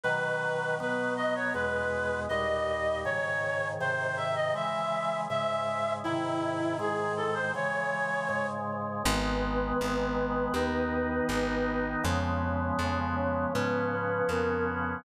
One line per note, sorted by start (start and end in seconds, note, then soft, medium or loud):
0.03 0.79 B2 medium
0.03 0.79 D#3 medium
0.03 0.79 F#3 medium
0.03 0.75 B4 loud
0.80 1.54 B2 medium
0.80 1.54 F#3 medium
0.80 1.54 B3 medium
0.80 1.13 B4 medium
1.16 1.34 D#5 medium
1.35 1.53 C#5 medium
1.54 2.28 E2 medium
1.54 2.28 B2 medium
1.54 2.28 G#3 medium
1.54 2.20 B4 medium
2.29 3.05 D#2 medium
2.29 3.05 A#2 medium
2.29 3.05 G3 medium
2.29 2.99 D#5 medium
3.05 3.79 G#2 medium
3.05 3.79 C#3 medium
3.05 3.79 D#3 medium
3.05 3.68 C#5 medium
3.80 4.55 G#2 medium
3.80 4.55 C3 medium
3.80 4.55 D#3 medium
3.80 4.17 C5 medium
4.17 4.35 E5 medium
4.35 4.53 D#5 medium
4.54 5.28 C#3 medium
4.54 5.28 E3 medium
4.54 5.28 G#3 medium
4.54 5.21 E5 medium
5.30 6.04 G#2 medium
5.30 6.04 C#3 medium
5.30 6.04 G#3 medium
5.30 5.93 E5 medium
6.04 6.79 G#2 medium
6.04 6.80 C3 medium
6.04 6.79 D#3 medium
6.04 6.77 E4 medium
6.79 7.53 G#2 medium
6.79 7.53 D#3 medium
6.79 7.53 G#3 medium
6.79 7.13 G#4 medium
7.17 7.35 A4 medium
7.34 7.52 C5 medium
7.55 8.28 C#3 medium
7.55 8.29 E3 medium
7.55 8.28 G#3 medium
7.55 8.47 C#5 medium
8.29 9.03 G#2 medium
8.29 9.03 C#3 medium
8.29 9.03 G#3 medium
9.05 9.73 G#1 loud
9.05 10.54 D#3 loud
9.05 10.54 G#3 loud
9.05 10.54 B3 loud
9.05 11.79 B3 medium
9.05 11.79 B4 medium
9.81 10.48 G#1 medium
10.54 11.21 D#2 medium
10.54 12.04 D#3 loud
10.54 12.03 B3 medium
10.54 12.04 D#4 loud
11.29 11.96 G#1 medium
12.04 12.72 F2 medium
12.04 13.52 C#3 loud
12.04 13.52 F3 loud
12.04 13.52 G#3 medium
12.04 13.52 B3 loud
12.04 13.00 C#4 medium
12.04 13.00 C#5 medium
12.79 13.46 F2 medium
13.16 13.52 C#4 medium
13.16 13.52 C#5 medium
13.53 14.23 G#2 medium
13.53 15.03 C#3 medium
13.53 15.03 F3 medium
13.53 13.86 B3 medium
13.53 15.03 B3 loud
13.53 15.03 C#4 medium
13.53 13.86 B4 medium
13.91 14.28 B3 medium
13.91 14.28 B4 medium
14.29 14.96 F2 medium
14.29 14.65 A#3 medium
14.29 14.65 A#4 medium
14.68 14.98 B3 medium
14.68 14.98 B4 medium